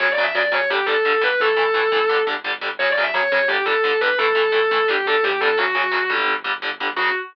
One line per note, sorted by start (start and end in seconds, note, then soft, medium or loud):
0.00 0.15 F#2 medium
0.00 0.07 C#3 medium
0.00 0.07 F#3 medium
0.00 0.11 C#5 loud
0.12 0.23 D5 loud
0.18 0.32 F#2 medium
0.18 0.25 C#3 medium
0.18 0.25 F#3 medium
0.23 0.34 E5 loud
0.35 0.50 F#2 medium
0.35 0.42 C#3 medium
0.35 0.42 F#3 medium
0.35 0.51 D5 loud
0.52 0.67 F#2 medium
0.52 0.59 C#3 medium
0.52 0.59 F#3 medium
0.52 0.67 C#5 loud
0.70 0.85 G1 medium
0.70 0.77 D3 medium
0.70 0.77 G3 medium
0.70 0.85 G4 loud
0.86 1.02 G1 medium
0.86 0.94 D3 medium
0.86 0.94 G3 medium
0.86 1.17 A4 loud
1.05 1.19 G1 medium
1.05 1.12 D3 medium
1.05 1.12 G3 medium
1.21 1.37 G1 medium
1.21 1.28 D3 medium
1.21 1.28 G3 medium
1.21 1.39 B4 loud
1.40 1.54 A1 loud
1.40 1.48 E3 medium
1.40 1.48 A3 medium
1.40 2.13 A4 loud
1.56 1.72 A1 medium
1.56 1.63 E3 medium
1.56 1.63 A3 medium
1.74 1.89 A1 medium
1.74 1.81 E3 medium
1.74 1.81 A3 medium
1.92 2.24 G1 loud
1.92 1.99 E3 medium
1.92 1.99 A3 medium
2.09 2.16 D3 medium
2.09 2.16 G3 medium
2.27 2.41 G1 medium
2.27 2.34 D3 medium
2.27 2.34 G3 medium
2.44 2.59 G1 medium
2.44 2.51 D3 medium
2.44 2.51 G3 medium
2.61 2.77 G1 medium
2.61 2.68 D3 medium
2.61 2.68 G3 medium
2.79 2.94 F#2 medium
2.79 2.87 C#3 medium
2.79 2.87 F#3 medium
2.79 2.90 C#5 loud
2.90 3.01 D5 loud
2.97 3.11 F#2 medium
2.97 3.04 C#3 medium
2.97 3.04 F#3 medium
3.03 3.14 E5 loud
3.14 3.29 F#2 medium
3.14 3.21 C#3 medium
3.14 3.21 F#3 medium
3.14 3.29 C#5 loud
3.31 3.46 F#2 loud
3.31 3.39 C#3 medium
3.31 3.39 F#3 medium
3.31 3.48 C#5 medium
3.48 3.64 G1 medium
3.48 3.56 D3 medium
3.48 3.56 G3 medium
3.48 3.63 G4 loud
3.65 3.81 G1 medium
3.65 3.73 D3 medium
3.65 3.73 G3 medium
3.65 3.94 A4 loud
3.84 3.98 G1 medium
3.84 3.91 D3 medium
3.84 3.91 G3 medium
4.01 4.16 G1 loud
4.01 4.08 D3 medium
4.01 4.08 G3 medium
4.01 4.17 B4 loud
4.18 4.33 A1 loud
4.18 4.26 E3 medium
4.18 4.26 A3 medium
4.18 4.48 A4 loud
4.35 4.51 A1 medium
4.35 4.42 E3 medium
4.35 4.42 A3 medium
4.52 4.68 A1 medium
4.52 4.59 E3 medium
4.52 4.59 A3 medium
4.52 4.85 A4 loud
4.71 4.86 A1 medium
4.71 4.78 E3 medium
4.71 4.78 A3 medium
4.88 5.03 G1 loud
4.88 4.95 D3 medium
4.88 4.95 G3 medium
4.88 5.05 G4 medium
5.06 5.20 G1 medium
5.06 5.14 D3 medium
5.06 5.14 G3 medium
5.06 5.22 A4 loud
5.23 5.39 E2 medium
5.23 5.31 D3 medium
5.23 5.31 G3 medium
5.23 5.41 G4 loud
5.40 5.56 F2 medium
5.40 5.49 D3 medium
5.40 5.49 G3 medium
5.40 5.56 A4 loud
5.57 5.73 F#2 medium
5.57 5.64 C#3 medium
5.57 5.64 F#3 medium
5.57 6.01 F#4 loud
5.75 5.90 F#2 loud
5.75 5.82 C#3 medium
5.75 5.82 F#3 medium
5.91 6.08 F#2 medium
5.91 5.98 C#3 medium
5.91 5.98 F#3 medium
6.10 6.25 F#2 medium
6.10 6.34 D3 medium
6.10 6.34 G3 medium
6.28 6.43 G1 medium
6.44 6.60 G1 medium
6.44 6.51 D3 medium
6.44 6.51 G3 medium
6.62 6.78 G1 medium
6.62 6.69 D3 medium
6.62 6.69 G3 medium
6.80 6.95 G1 medium
6.80 6.87 D3 medium
6.80 6.87 G3 medium
6.96 7.10 F#2 loud
6.96 7.09 C#3 medium
6.96 7.09 F#3 medium
6.96 7.09 F#4 loud